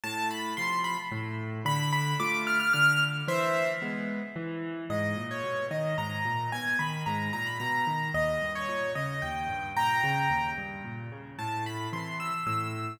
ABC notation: X:1
M:3/4
L:1/16
Q:1/4=111
K:Am
V:1 name="Acoustic Grand Piano"
a2 b2 c'2 b z5 | b2 b2 d'2 f' f' f'2 z2 | [ce]3 z9 | [K:G#m] d3 c3 d2 a4 |
g2 b2 a2 a b a4 | d3 c3 d2 =g4 | [=ga]6 z6 | [K:Am] a2 b2 c'2 e' e' e'4 |]
V:2 name="Acoustic Grand Piano"
A,,4 [C,F,]4 A,,4 | D,4 [A,F]4 D,4 | E,4 [^G,B,]4 E,4 | [K:G#m] G,,2 A,,2 B,,2 D,2 G,,2 A,,2 |
B,,2 D,2 G,,2 A,,2 B,,2 D,2 | D,,2 =G,,2 A,,2 C,2 D,,2 G,,2 | A,,2 C,2 D,,2 =G,,2 A,,2 C,2 | [K:Am] A,,4 [C,E,]4 A,,4 |]